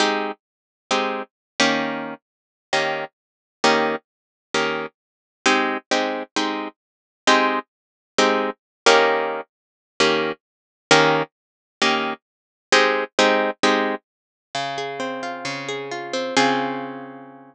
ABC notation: X:1
M:4/4
L:1/8
Q:1/4=132
K:Ab
V:1 name="Acoustic Guitar (steel)"
[A,CEG]4 [A,CEG]3 [E,B,DG]- | [E,B,DG]4 [E,B,DG]4 | [E,B,DG]4 [E,B,DG]4 | [A,CEG]2 [A,CEG]2 [A,CEG]4 |
[A,CEG]4 [A,CEG]3 [E,B,DG]- | [E,B,DG]4 [E,B,DG]4 | [E,B,DG]4 [E,B,DG]4 | [A,CEG]2 [A,CEG]2 [A,CEG]4 |
[K:Db] D, A C F D, A F C | [D,CFA]8 |]